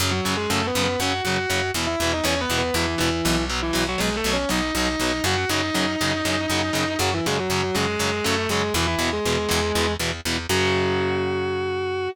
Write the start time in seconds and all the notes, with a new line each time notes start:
0.00 F#2 C#3 F#3
0.11 F#3 F#4
0.25 F#2 C#3 F#3
0.37 G#3 G#4
0.50 F#2 C#3 F#3 A3 A4
0.67 B3 B4
0.75 F#2 C#3 F#3
0.83 B3 B4
0.99 F#2 C#3 F#3 F#4 F#5
1.24 F#2 C#3 F#3 F#4 F#5
1.50 F#2 C#3 F#3
1.74 E2 B2 E3
1.87 E4 E5
2.00 E2 B2 E3
2.13 D#4 D#5
2.24 E2 B2 E3 C#4 C#5
2.41 B3 B4
2.50 E2 B2 E3
2.58 B3 B4
2.74 E2 B2 E3 E4
2.98 E2 B2 E3 E4
3.25 B1 B2 E3
3.50 B2 F#3
3.62 E3 E4
3.73 B1 B2 F#3
3.88 F#3 F#4
3.98 B1 B2 F#3 G#3 G#4
4.16 A3 A4
4.24 B1 B2 F#3
4.33 C#4 C#5
4.49 B1 B2 F#3 D#4 D#5
4.75 B1 B2 F#3 D#4 D#5
5.00 B1 B2 F#3
5.24 F#2 C#3 F#3 F#4 F#5
5.37 F#4 F#5
5.49 F#2 C#3 F#3 D#4 D#5
5.74 F#2 C#3 F#3
6.01 F#2 C#3 F#3
6.25 F#2 C#3 F#3
6.50 F#2 C#3 F#3
6.73 F#2 C#3 F#3
6.99 F#2 C#3 F#3 F#4
7.14 E3 E4
7.26 F#2 C#3 F#3 G#3 G#4
7.39 F#3 F#4
7.50 F#2 C#3 F#3
7.63 F#3 F#4
7.75 F#2 C#3 F#3 G#3 G#4
7.99 F#2 C#3 F#3
8.24 F#2 C#3 F#3 A3 A4
8.49 F#2 C#3 F#3 G#3 G#4
8.74 E2 B2 E3 E4
8.87 E3 E4
8.99 E2 B2 E3
9.13 G#3 G#4
9.25 E2 B2 E3
9.49 E2 B2 E3
9.75 E2 B2 E3
9.99 E2 B2 E3
10.25 E2 B2 E3
10.49 F#2 C#3 F#3 F#4